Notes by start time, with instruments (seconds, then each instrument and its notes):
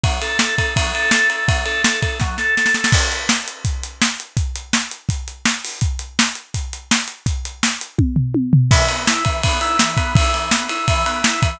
0.03 drawbar organ F#3, kick, ride
0.22 drawbar organ A4, ride
0.39 drawbar organ A4, snare
0.58 drawbar organ A4, kick, ride
0.76 drawbar organ F#3, kick, ride
0.94 drawbar organ A4, ride
1.11 drawbar organ A4, snare
1.30 drawbar organ A4, ride
1.48 drawbar organ F#3, kick, ride
1.66 drawbar organ A4, ride
1.84 drawbar organ A4, snare
2.02 drawbar organ A4, kick, ride
2.20 drawbar organ F#3, kick, snare
2.38 drawbar organ A4, snare
2.57 drawbar organ A4, snare
2.66 snare
2.74 drawbar organ A4, snare
2.84 snare
2.92 kick, crash
3.12 closed hi-hat
3.29 snare
3.48 closed hi-hat
3.65 kick, closed hi-hat
3.83 closed hi-hat
4.02 snare
4.20 closed hi-hat
4.37 kick, closed hi-hat
4.55 closed hi-hat
4.73 snare
4.91 closed hi-hat
5.09 kick, closed hi-hat
5.28 closed hi-hat
5.45 snare
5.65 open hi-hat
5.81 kick, closed hi-hat
5.99 closed hi-hat
6.19 snare
6.35 closed hi-hat
6.54 kick, closed hi-hat
6.73 closed hi-hat
6.91 snare
7.08 closed hi-hat
7.26 kick, closed hi-hat
7.45 closed hi-hat
7.63 snare
7.81 closed hi-hat
7.98 kick, high tom
8.16 floor tom
8.34 high tom
8.53 floor tom
8.71 drawbar organ E3, kick, crash
8.89 drawbar organ B3, ride
9.07 drawbar organ E4, snare
9.25 drawbar organ E3, kick, ride
9.43 drawbar organ B3, kick, ride
9.61 drawbar organ E4, ride
9.79 drawbar organ E3, snare
9.97 drawbar organ B3, kick, ride
10.15 drawbar organ E4, kick, ride
10.34 drawbar organ E3, ride
10.51 drawbar organ B3, snare
10.69 drawbar organ E4, ride
10.88 drawbar organ E3, kick, ride
11.06 drawbar organ B3, ride
11.24 drawbar organ E4, snare
11.42 drawbar organ E3, kick, ride